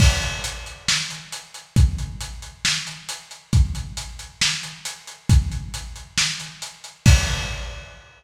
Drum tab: CC |x-------|--------|--------|--------|
HH |-xxx-xxx|xxxx-xxx|xxxx-xxx|xxxx-xxx|
SD |----o---|----o---|----o---|----o---|
BD |o-------|o-------|o-------|o-------|

CC |x-------|
HH |--------|
SD |--------|
BD |o-------|